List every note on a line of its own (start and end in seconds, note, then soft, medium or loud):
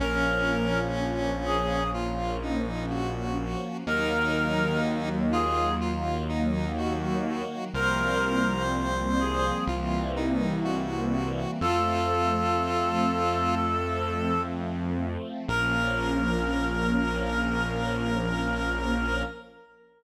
0.00 3.56 A#1 medium
0.00 3.83 F3 medium
0.00 3.83 A#3 medium
0.00 1.84 C#4 loud
0.00 3.83 C#4 medium
0.00 0.79 A#4 loud
1.45 1.90 G#4 medium
1.94 2.37 F4 medium
2.42 2.86 D#4 medium
2.90 3.77 F#4 medium
3.85 7.43 D#2 medium
3.85 7.69 D#3 medium
3.85 7.69 F#3 medium
3.85 7.69 A#3 loud
3.85 5.09 D#4 loud
3.85 4.79 A#4 loud
5.32 5.71 F4 loud
5.32 5.74 G#4 loud
5.81 6.24 F4 medium
6.29 6.72 D#4 medium
6.77 7.65 F#4 medium
7.74 9.52 C2 medium
7.74 9.67 F3 medium
7.74 9.67 G3 medium
7.74 9.67 A#3 medium
7.74 9.67 C4 loud
7.74 8.63 A#4 loud
7.74 9.58 C5 loud
9.20 9.64 G#4 medium
9.67 11.45 C2 medium
9.67 11.59 E3 loud
9.67 11.59 G3 medium
9.67 11.59 A#3 medium
9.67 11.59 C4 medium
9.67 10.11 F4 medium
10.16 10.60 D#4 medium
10.64 11.51 F#4 medium
11.61 15.17 F2 medium
11.61 15.45 F3 medium
11.61 15.45 A3 medium
11.61 15.45 C4 medium
11.61 13.55 F4 loud
11.61 14.41 A4 loud
15.48 19.23 A#1 loud
15.48 19.23 F3 medium
15.48 19.23 A#3 loud
15.48 19.23 C#4 loud
15.48 19.23 A#4 loud